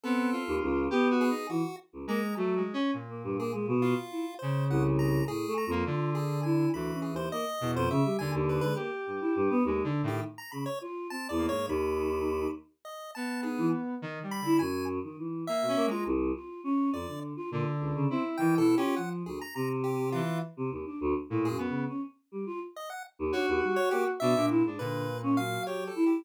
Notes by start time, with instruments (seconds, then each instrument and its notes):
0.04 lead 1 (square) B3 A4, choir aahs C4
0.33 lead 1 (square) F4
0.47 choir aahs D#2
0.62 choir aahs C#2
0.90 choir aahs B3, lead 1 (square) G4
1.11 lead 1 (square) F#4
1.21 lead 1 (square) G#4
1.30 lead 1 (square) D#4
1.49 choir aahs E3, lead 1 (square) F#4
1.93 choir aahs C#2
2.07 lead 1 (square) G#3 A#5, choir aahs A#3
2.36 choir aahs F#3, lead 1 (square) A3
2.56 lead 1 (square) G#3
2.73 lead 1 (square) C#4
2.94 lead 1 (square) A#2
3.09 choir aahs A#3
3.24 choir aahs G2
3.38 choir aahs A#3, lead 1 (square) G#4
3.53 choir aahs G#3
3.68 choir aahs B2
3.82 lead 1 (square) F4
4.11 choir aahs E4
4.39 lead 1 (square) C#3 C5
4.69 choir aahs C2, lead 1 (square) F#5
4.99 lead 1 (square) A#5
5.28 choir aahs A2, lead 1 (square) G#4
5.47 choir aahs A3
5.58 lead 1 (square) A#5
5.67 choir aahs F2
5.71 lead 1 (square) A#3
5.86 lead 1 (square) D3, choir aahs F4
6.15 lead 1 (square) G#4
6.43 choir aahs E4, lead 1 (square) G#5
6.73 choir aahs D2, lead 1 (square) E3 B5
6.93 choir aahs C#4
7.02 lead 1 (square) G#4
7.12 choir aahs D#2, lead 1 (square) C5
7.32 choir aahs A#3, lead 1 (square) D#5
7.61 choir aahs E2, lead 1 (square) B2
7.75 choir aahs F2, lead 1 (square) C5
7.90 choir aahs C#3, lead 1 (square) E5
8.04 choir aahs G3
8.19 choir aahs D#2, lead 1 (square) D3 G#5
8.34 choir aahs D#2
8.49 lead 1 (square) B4
8.61 choir aahs G#3, lead 1 (square) B4
8.75 choir aahs A#3, lead 1 (square) G4
9.07 choir aahs G2
9.21 choir aahs E4
9.36 choir aahs G2
9.50 choir aahs B3
9.65 choir aahs D#2, lead 1 (square) G#3
9.84 lead 1 (square) D3, choir aahs D4
10.03 lead 1 (square) A2, choir aahs D#3
10.08 lead 1 (square) G4
10.38 lead 1 (square) A#5
10.52 choir aahs C#3, lead 1 (square) B5
10.66 lead 1 (square) C#5
10.81 choir aahs F4
11.10 choir aahs C4, lead 1 (square) A5
11.29 choir aahs E2, lead 1 (square) D5
11.38 lead 1 (square) A#3
11.49 choir aahs G#2, lead 1 (square) C#5
11.67 choir aahs D#2, lead 1 (square) D#3 B5
12.85 lead 1 (square) D#5
13.15 lead 1 (square) B3 A5
13.43 choir aahs D#4, lead 1 (square) G#4
13.58 choir aahs E3
14.02 lead 1 (square) D#3
14.23 lead 1 (square) G3
14.31 lead 1 (square) B5
14.41 lead 1 (square) D3
14.45 choir aahs E4
14.59 choir aahs F#2, lead 1 (square) G#5
15.04 choir aahs D#3
15.18 choir aahs E3
15.47 lead 1 (square) A#3 E5
15.62 choir aahs B2
15.68 lead 1 (square) C#4
15.76 choir aahs A#3
15.86 lead 1 (square) G#3
15.91 choir aahs F4, lead 1 (square) A#5
16.05 choir aahs C2
16.35 choir aahs F4
16.64 choir aahs C#4
16.93 choir aahs F2, lead 1 (square) D5
17.07 choir aahs D3
17.36 choir aahs F4
17.51 choir aahs A#2, lead 1 (square) D3
17.80 choir aahs C#2
17.95 choir aahs C#3
18.09 choir aahs C4, lead 1 (square) E4
18.37 lead 1 (square) D#3 G5, choir aahs E3
18.58 lead 1 (square) B2 A4, choir aahs E4
18.77 lead 1 (square) C#4 G4, choir aahs F4
18.96 choir aahs F3, lead 1 (square) F#5
19.26 choir aahs D2, lead 1 (square) G#4
19.41 lead 1 (square) A#5
19.55 choir aahs C3, lead 1 (square) A#5
19.84 lead 1 (square) G4
20.12 lead 1 (square) E3 F4
20.57 choir aahs C3
20.71 choir aahs D#2
20.86 choir aahs D4
21.01 choir aahs D2
21.30 choir aahs A2, lead 1 (square) A#2
21.45 lead 1 (square) G#4
21.49 choir aahs F#2
21.58 lead 1 (square) B3
21.69 choir aahs C#3
21.88 choir aahs C#4
22.32 choir aahs G3
22.46 choir aahs F4
22.76 lead 1 (square) D#5
22.90 lead 1 (square) F#5
23.19 choir aahs D#2
23.32 choir aahs D4, lead 1 (square) F#4 C#5
23.48 choir aahs D#2
23.63 choir aahs G3
23.76 lead 1 (square) C#5
23.91 choir aahs A#3, lead 1 (square) G4
24.20 choir aahs B2, lead 1 (square) D4 E5
24.36 lead 1 (square) A#2, choir aahs D4
24.50 choir aahs E4
24.65 choir aahs G#2, lead 1 (square) D4
24.79 lead 1 (square) A#2 B4, choir aahs D3
25.23 choir aahs C#4
25.37 choir aahs F#3, lead 1 (square) F5
25.66 lead 1 (square) G4 C#5
25.87 lead 1 (square) A4
25.96 choir aahs E4
26.06 lead 1 (square) G4